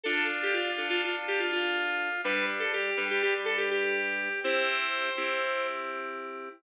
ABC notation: X:1
M:9/8
L:1/16
Q:3/8=82
K:Am
V:1 name="Electric Piano 2"
A2 z G F3 F F z G F F6 | B2 z A G3 G G z A G G6 | c12 z6 |]
V:2 name="Electric Piano 2"
[DF]6 [DFA]12 | [G,D]6 [G,DB]12 | [CEG]6 [CEG]12 |]